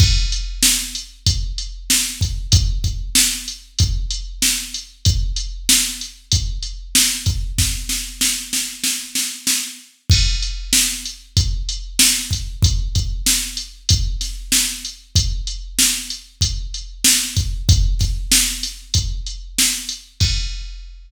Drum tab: CC |x-------|--------|--------|--------|
HH |-x-xxx-x|xx-xxx-x|xx-xxx-x|--------|
SD |--o---o-|--o---o-|--o---o-|ooooooo-|
BD |o---o--o|oo--o---|o---o--o|o-------|

CC |x-------|--------|--------|--------|
HH |-x-xxx-x|xx-xxx-x|xx-xxx-x|xx-xxx-x|
SD |--o---o-|--o--oo-|--o---o-|-ooo--o-|
BD |o---o--o|oo--o---|o---o--o|oo--o---|

CC |x-------|
HH |--------|
SD |--------|
BD |o-------|